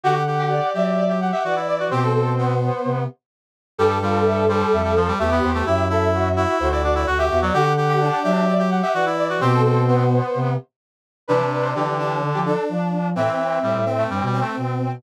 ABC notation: X:1
M:4/4
L:1/16
Q:1/4=128
K:Am
V:1 name="Brass Section"
^f6 e4 f4 d2 | c10 z6 | G2 F2 e2 c2 e2 c2 e2 c2 | G2 A2 ^F2 F2 F2 F2 F2 F2 |
^f6 e4 f4 d2 | c10 z6 | [K:C] B2 B c G4 z G A2 z4 | e8 z8 |]
V:2 name="Brass Section"
^F z2 G d4 d z2 e d4 | G A3 B,6 z6 | A12 G4 | e2 e6 c d2 d z e2 d |
^F z2 G D4 d z2 e d4 | G A3 B,6 z6 | [K:C] D6 D4 D6 | C6 C4 C6 |]
V:3 name="Brass Section"
G2 G4 G3 G G G ^F E2 F | C2 C4 z10 | G,2 G,4 G,3 G, F, G, A, B,2 A, | E2 E4 E3 E D E ^F G2 ^F, |
G2 G4 G3 G G G ^F E2 F | C2 C4 z10 | [K:C] C,4 D,8 z4 | E,4 G,2 z A, (3G,2 G,2 A,2 z4 |]
V:4 name="Brass Section" clef=bass
D,6 ^F,6 E,4 | B,,8 C,2 z6 | G,,8 F,,4 E,,2 E,,2 | ^F,,8 D,,4 D,,2 E,,2 |
D,6 ^F,6 E,4 | B,,8 C,2 z6 | [K:C] E, z3 E, E,3 D, F,2 z F,4 | A,, z3 A,, A,,3 G,, B,,2 z B,,4 |]